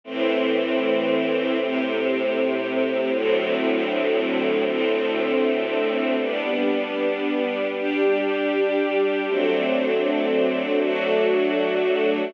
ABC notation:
X:1
M:4/4
L:1/8
Q:1/4=78
K:G
V:1 name="String Ensemble 1"
[A,,E,C]4 [A,,C,C]4 | [D,,A,,F,C]4 [D,,A,,A,C]4 | [G,B,D]4 [G,DG]4 | [F,A,CD]4 [F,A,DF]4 |]